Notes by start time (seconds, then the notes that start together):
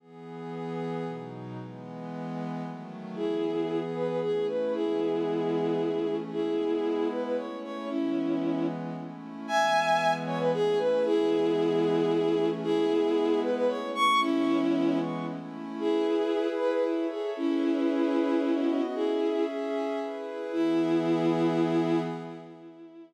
0.00 E3 B3 G#4
1.05 B2 F#3 D#4
1.58 E3 G#3 B3
2.63 D#3 F#3 A3
3.15 E3 B3 E4 G#4
3.94 B4
4.08 B4
4.21 A3 C#4 E4 G#4
4.48 B4
4.73 E3 G#3 B3 E4 G#4
5.79 E3 A3 C#4
6.31 G#3 B3 E4 G#4
7.10 B4
7.24 B4
7.37 A3 C#4 E4 C#5
7.63 C#5
7.89 E3 G#3 B3 C#4 E4
8.95 A3 C#4 E4
9.47 E3 G#3 B3 E5 G#5
10.26 C#5
10.39 B4
10.53 A3 C#4 E4 G#4
10.79 B4
11.05 E3 G#3 B3 E4 G#4
12.11 E3 A3 C#4
12.63 G#3 B3 E4 G#4
13.42 B4
13.56 B4
13.68 A3 C#4 E4 C#5
13.95 C#6
14.21 E3 G#3 B3 C#4 E4
15.26 A3 C#4 E4
15.79 E4 G#4 B4
16.58 B4
16.71 B4
16.84 E4 A4 C#5 E5
17.10 G#4
17.37 C#4 E4 G#4 B4
18.42 B3 F#4 D#5
18.94 C#4 E4 G#4 E5
20.00 E4 G#4 B4
20.52 E3 B3 E4 G#4